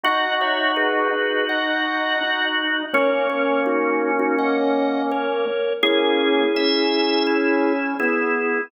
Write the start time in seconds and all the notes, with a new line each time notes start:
0.03 D#4 F#4 D#5 F#5
0.41 C#5 E5
0.76 G#4 B4
1.13 D#4
1.49 D#5 F#5
2.21 D#4
2.93 A#3 C#4 A#4 C#5
3.30 A#4 C#5
3.66 D#4 F#4
4.19 D#4 F#4
4.39 D#5 F#5
5.11 A#4 C#5
5.83 A#3 C#4 E4 G#4
6.55 C#4 E5
7.27 E4
7.99 B3 E4 G#4